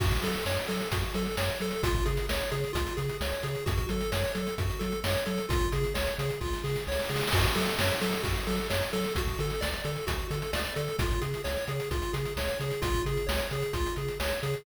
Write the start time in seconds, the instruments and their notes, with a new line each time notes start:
0.00 synth bass 1 F#2, lead 1 (square) F#4, kick, crash
0.11 kick, closed hi-hat
0.22 synth bass 1 F#3, lead 1 (square) A4, closed hi-hat
0.35 closed hi-hat
0.46 synth bass 1 F#2, lead 1 (square) C#5, snare
0.57 closed hi-hat
0.68 synth bass 1 F#3, lead 1 (square) A4, closed hi-hat
0.81 closed hi-hat
0.92 synth bass 1 F#2, lead 1 (square) F#4, kick, closed hi-hat
1.03 closed hi-hat
1.14 synth bass 1 F#3, lead 1 (square) A4, closed hi-hat
1.26 closed hi-hat
1.37 synth bass 1 F#2, lead 1 (square) C#5, snare
1.50 closed hi-hat
1.60 synth bass 1 F#3, lead 1 (square) A4, closed hi-hat
1.71 closed hi-hat
1.83 synth bass 1 C#2, lead 1 (square) F4, kick, closed hi-hat
1.94 kick, closed hi-hat
2.06 synth bass 1 C#3, lead 1 (square) G#4, closed hi-hat
2.17 closed hi-hat
2.29 synth bass 1 C#2, lead 1 (square) C#5, snare
2.41 closed hi-hat
2.52 synth bass 1 C#3, lead 1 (square) G#4, closed hi-hat
2.64 closed hi-hat
2.73 synth bass 1 C#2, lead 1 (square) F4, kick, closed hi-hat
2.87 closed hi-hat
2.97 synth bass 1 C#3, lead 1 (square) G#4, closed hi-hat
3.09 closed hi-hat
3.21 synth bass 1 C#2, lead 1 (square) C#5, snare
3.32 closed hi-hat
3.43 synth bass 1 C#3, lead 1 (square) G#4, closed hi-hat
3.55 closed hi-hat
3.66 synth bass 1 F#2, lead 1 (square) F#4, kick, closed hi-hat
3.78 kick, closed hi-hat
3.89 synth bass 1 F#3, lead 1 (square) A4, closed hi-hat
4.01 closed hi-hat
4.12 synth bass 1 F#2, lead 1 (square) C#5, snare
4.24 closed hi-hat
4.35 synth bass 1 F#3, lead 1 (square) A4, closed hi-hat
4.47 closed hi-hat
4.58 synth bass 1 F#2, lead 1 (square) F#4, kick, closed hi-hat
4.70 closed hi-hat
4.79 synth bass 1 F#3, lead 1 (square) A4, closed hi-hat
4.92 closed hi-hat
5.04 synth bass 1 F#2, lead 1 (square) C#5, snare
5.15 closed hi-hat
5.26 synth bass 1 F#3, lead 1 (square) A4, closed hi-hat
5.38 closed hi-hat
5.49 synth bass 1 C#2, lead 1 (square) F4, kick, closed hi-hat
5.61 kick, closed hi-hat
5.72 synth bass 1 C#3, lead 1 (square) G#4, closed hi-hat
5.84 closed hi-hat
5.94 synth bass 1 C#2, lead 1 (square) C#5, snare
6.07 closed hi-hat
6.18 synth bass 1 C#3, lead 1 (square) G#4, closed hi-hat
6.30 closed hi-hat
6.41 synth bass 1 C#2, lead 1 (square) F4, kick, snare
6.53 snare
6.64 synth bass 1 C#3, lead 1 (square) G#4, snare
6.76 snare
6.87 synth bass 1 C#2, lead 1 (square) C#5, snare
6.92 snare
6.99 snare
7.04 snare
7.09 synth bass 1 C#3, lead 1 (square) G#4, snare
7.16 snare
7.21 snare
7.27 snare
7.32 synth bass 1 F#2, lead 1 (square) F#4, kick, crash
7.43 kick, closed hi-hat
7.55 synth bass 1 F#3, lead 1 (square) A4, closed hi-hat
7.67 closed hi-hat
7.79 synth bass 1 F#2, lead 1 (square) C#5, snare
7.90 closed hi-hat
8.01 synth bass 1 F#3, lead 1 (square) A4, closed hi-hat
8.13 closed hi-hat
8.23 synth bass 1 F#2, lead 1 (square) F#4, kick, closed hi-hat
8.36 closed hi-hat
8.47 synth bass 1 F#3, lead 1 (square) A4, closed hi-hat
8.58 closed hi-hat
8.70 synth bass 1 F#2, lead 1 (square) C#5, snare
8.82 closed hi-hat
8.93 synth bass 1 F#3, lead 1 (square) A4, closed hi-hat
9.04 closed hi-hat
9.15 synth bass 1 D2, lead 1 (square) F#4, kick, closed hi-hat
9.27 kick, closed hi-hat
9.39 synth bass 1 D3, lead 1 (square) A4, closed hi-hat
9.50 closed hi-hat
9.61 synth bass 1 D2, lead 1 (square) D5, snare
9.73 closed hi-hat
9.84 synth bass 1 D3, lead 1 (square) A4, closed hi-hat
9.96 closed hi-hat
10.07 synth bass 1 D2, lead 1 (square) F#4, kick, closed hi-hat
10.19 closed hi-hat
10.31 synth bass 1 D3, lead 1 (square) A4, closed hi-hat
10.42 closed hi-hat
10.53 synth bass 1 D2, lead 1 (square) D5, snare
10.65 closed hi-hat
10.76 synth bass 1 D3, lead 1 (square) A4, closed hi-hat
10.88 closed hi-hat
10.99 synth bass 1 C#2, lead 1 (square) F4, kick, closed hi-hat
11.11 kick, closed hi-hat
11.21 synth bass 1 C#3, lead 1 (square) G#4, closed hi-hat
11.34 closed hi-hat
11.44 synth bass 1 C#2, lead 1 (square) C#5, snare
11.56 closed hi-hat
11.67 synth bass 1 C#3, lead 1 (square) G#4, closed hi-hat
11.80 closed hi-hat
11.91 synth bass 1 C#2, lead 1 (square) F4, kick, closed hi-hat
12.02 closed hi-hat
12.13 synth bass 1 C#3, lead 1 (square) G#4, closed hi-hat
12.25 closed hi-hat
12.37 synth bass 1 C#2, lead 1 (square) C#5, snare
12.48 closed hi-hat
12.60 synth bass 1 C#3, lead 1 (square) G#4, closed hi-hat
12.71 closed hi-hat
12.82 synth bass 1 C#2, lead 1 (square) F4, kick, closed hi-hat
12.94 kick, closed hi-hat
13.05 synth bass 1 C#3, lead 1 (square) G#4, closed hi-hat
13.17 closed hi-hat
13.27 synth bass 1 C#2, lead 1 (square) C#5, snare
13.40 closed hi-hat
13.51 synth bass 1 C#3, lead 1 (square) G#4, closed hi-hat
13.62 closed hi-hat
13.73 synth bass 1 C#2, lead 1 (square) F4, kick, closed hi-hat
13.86 closed hi-hat
13.96 synth bass 1 C#3, lead 1 (square) G#4, closed hi-hat
14.08 closed hi-hat
14.20 synth bass 1 C#2, lead 1 (square) C#5, snare
14.31 closed hi-hat
14.43 synth bass 1 C#3, lead 1 (square) G#4, closed hi-hat
14.54 closed hi-hat